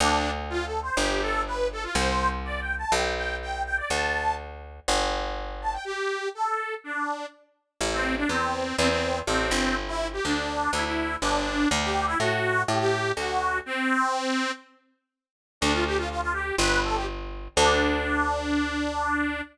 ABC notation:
X:1
M:4/4
L:1/16
Q:1/4=123
K:Ddor
V:1 name="Accordion"
D3 z (3F2 A2 c2 G2 A2 B2 A F | c3 z (3d2 g2 a2 g2 g2 g2 g d | a4 z10 a g | G4 A4 D4 z4 |
[K:Ador] z C2 D C4 C C3 C4 | z E2 G D4 E E3 D4 | z G2 E F4 G G3 F4 | C8 z8 |
[K:Ddor] D F G F F F G2 B2 A G z4 | D16 |]
V:2 name="Electric Bass (finger)" clef=bass
D,,8 G,,,8 | C,,8 B,,,8 | D,,8 G,,,8 | z16 |
[K:Ador] A,,,4 E,,4 E,,4 A,,,2 G,,,2- | G,,,4 D,,4 D,,4 G,,,4 | D,,4 A,,4 A,,4 D,,4 | z16 |
[K:Ddor] D,,8 G,,,8 | D,,16 |]